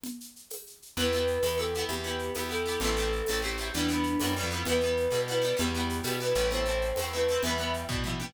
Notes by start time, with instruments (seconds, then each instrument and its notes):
0.03 low conga, shaker
0.20 shaker
0.36 shaker
0.50 tambourine, high conga, shaker
0.67 shaker
0.82 shaker
0.97 electric bass (finger) E2, orchestral harp B3 E4 G4, flute B4, low conga, shaker
1.12 orchestral harp B3 E4 G4, shaker
1.27 shaker
1.42 electric bass (finger) E2, orchestral harp B3 E4 G4, tambourine, high conga, shaker
1.57 orchestral harp B3 E4 G4, flute A4, shaker
1.74 orchestral harp B3 E4, shaker
1.79 orchestral harp G4
1.89 electric bass (finger) E2, flute G4, low conga, shaker
2.03 orchestral harp B3 E4, shaker
2.07 orchestral harp G4
2.19 shaker
2.34 electric bass (finger) E2, orchestral harp B3 E4 G4, tambourine, high conga, shaker
2.49 orchestral harp B3 E4 G4, flute A4, shaker
2.66 orchestral harp B3 E4 G4, shaker
2.80 electric bass (finger) A1, orchestral harp A3 C4, flute A4, low conga, shaker
2.85 orchestral harp E4
2.97 orchestral harp A3 C4 E4, shaker
3.12 shaker
3.26 electric bass (finger) A1, orchestral harp A3 C4, tambourine, high conga, shaker
3.31 orchestral harp E4
3.42 orchestral harp A3 C4 E4, flute G4, shaker
3.58 orchestral harp A3 C4 E4, shaker
3.74 electric bass (finger) E2, orchestral harp G3 B3 E4, flute D4, low conga, shaker
3.89 orchestral harp G3 B3 E4, shaker
4.03 shaker
4.20 electric bass (finger) F#2, orchestral harp G3 B3 E4, tambourine, high conga, shaker
4.36 orchestral harp G3 B3 E4, shaker
4.43 electric bass (finger) F2
4.51 orchestral harp G3 B3 E4, shaker
4.65 electric bass (finger) E2, orchestral harp G3 B3, flute B4, low conga, shaker
4.70 orchestral harp E4
4.80 orchestral harp G3 B3, shaker
4.85 orchestral harp E4
4.97 shaker
5.11 electric bass (finger) B2, orchestral harp G3 B3 E4, high conga, shaker
5.28 orchestral harp G3 B3 E4, flute B4, shaker
5.42 orchestral harp G3 B3 E4, shaker
5.57 electric bass (finger) E2, orchestral harp G3 B3 E4, flute G4, low conga, shaker
5.74 orchestral harp G3 B3 E4, shaker
5.89 shaker
6.03 electric bass (finger) B2, orchestral harp G3 B3 E4, tambourine, high conga, shaker
6.20 orchestral harp G3 B3 E4, flute B4, shaker
6.35 electric bass (finger) A1, orchestral harp G3 B3 E4, shaker
6.51 orchestral harp A3 C4 E4, flute C5, low conga, shaker
6.66 orchestral harp A3 C4 E4, shaker
6.81 shaker
6.96 electric bass (finger) E2, orchestral harp A3 C4, tambourine, high conga, shaker
7.01 orchestral harp E4
7.12 orchestral harp A3 C4 E4, flute B4, shaker
7.28 orchestral harp A3 C4 E4, shaker
7.43 electric bass (finger) E2, orchestral harp G3 B3, flute E5, low conga, shaker
7.47 orchestral harp E4
7.58 orchestral harp G3 B3 E4, shaker
7.74 shaker
7.89 electric bass (finger) B2, orchestral harp G3 B3 E4, kick, floor tom
8.03 orchestral harp G3 B3 E4, mid tom
8.20 orchestral harp G3 B3 E4, high tom